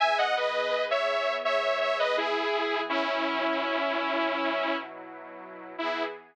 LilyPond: <<
  \new Staff \with { instrumentName = "Lead 2 (sawtooth)" } { \time 4/4 \key e \major \tempo 4 = 83 <e'' gis''>16 <dis'' fis''>16 <b' dis''>8. <cis'' e''>8. <cis'' e''>8 <cis'' e''>16 <b' dis''>16 <e' gis'>4 | <cis' e'>2. r4 | e'4 r2. | }
  \new Staff \with { instrumentName = "Pad 5 (bowed)" } { \time 4/4 \key e \major <e b gis'>1 | <b, fis e'>1 | <e b gis'>4 r2. | }
>>